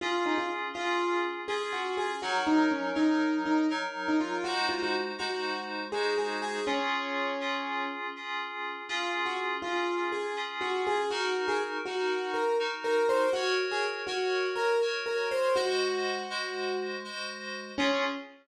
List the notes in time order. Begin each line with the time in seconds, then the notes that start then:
0.01 C#4 F4 G#4
0.26 D#4
0.38 F4
0.73 C#4 F4 G#4
1.48 C#4 F4 G#4
1.73 F#4
1.97 G#4
2.22 F#3 D#4 F#4 A#4
2.47 D#4
2.71 C#4
2.95 F#3 D#4 A#4
3.45 D#4
3.70 F#3 D#4 A#4
4.08 D#4
4.20 F4
4.44 G#3 D#4 F#4 C5
4.69 F4
4.82 F#4
5.18 G#3 D#4 F#4 C5
5.92 G#3 D#4 F#4 G#4 C5
6.18 G#4
6.42 G#4
6.66 C#4 F4 G#4
7.41 C#4 F4 G#4
8.16 C#4 F4 G#4
8.89 C#4 F4 G#4
9.26 F#4
9.62 C#4 F4 G#4
10.12 G#4
10.36 C#4 F4 G#4
10.61 F#4
10.87 G#4
11.10 D#4 F#4 A#4
11.48 G#4
11.85 D#4 F#4 A#4
12.34 A#4
12.59 D#4 F#4 A#4
12.84 A#4
13.09 C5
13.33 F#4 A#4 C#5
13.71 G#4
14.07 F#4 A#4 C#5
14.56 A#4
14.81 F#4 A#4 C#5
15.06 A#4
15.31 C5
15.55 G#3 F#4 C5 D#5
16.30 G#3 F#4 C5 D#5
17.04 G#3 F#4 C5 D#5
17.78 C#4 F4 G#4